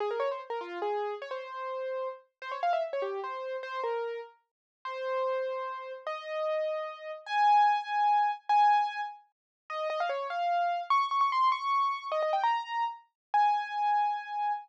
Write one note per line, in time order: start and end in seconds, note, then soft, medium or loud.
0.00 0.10 G#4 loud
0.11 0.20 A#4 medium
0.20 0.29 C#5 medium
0.31 0.41 C5 medium
0.50 0.60 A#4 medium
0.61 0.79 F4 loud
0.82 1.14 G#4 medium
1.22 1.31 C#5 loud
1.31 2.08 C5 medium
2.42 2.51 C5 loud
2.52 2.61 C#5 medium
2.63 2.72 F5 loud
2.73 2.83 E5 medium
2.93 3.03 C#5 medium
3.02 3.20 G4 medium
3.24 3.56 C5 medium
3.63 3.80 C5 loud
3.84 4.20 A#4 medium
4.85 5.93 C5 loud
6.07 7.11 D#5 loud
7.26 8.31 G#5 loud
8.49 9.01 G#5 loud
9.70 9.88 D#5 loud
9.90 9.99 D#5 loud
10.00 10.10 F5 loud
10.09 10.27 C#5 medium
10.30 10.82 F5 medium
10.90 11.07 C#6 loud
11.11 11.20 C#6 medium
11.21 11.31 C#6 medium
11.32 11.49 C6 loud
11.52 12.07 C#6 loud
12.12 12.21 D#5 loud
12.22 12.32 D#5 medium
12.33 12.43 G5 medium
12.43 12.84 A#5 loud
13.34 14.52 G#5 loud